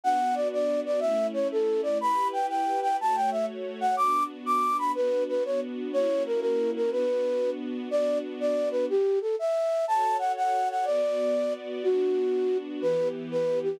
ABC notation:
X:1
M:6/8
L:1/8
Q:3/8=122
K:Bm
V:1 name="Flute"
f2 d d2 d | e2 c A2 d | b2 g g2 g | a g e z2 f |
d'2 z d'2 b | B2 B c z2 | c2 ^A A2 A | B4 z2 |
d2 z d2 B | G2 A e3 | a2 f f2 f | d5 z |
F5 z | B2 z B2 G |]
V:2 name="String Ensemble 1"
[B,DF]6 | [A,CE]6 | [EGB]6 | [A,Fc]6 |
[B,DF]6 | [B,DF]6 | [^A,CEF]6 | [B,DF]6 |
[B,DF]6 | z6 | [FAc]6 | [B,Fd]6 |
[B,DF]6 | [E,B,G]6 |]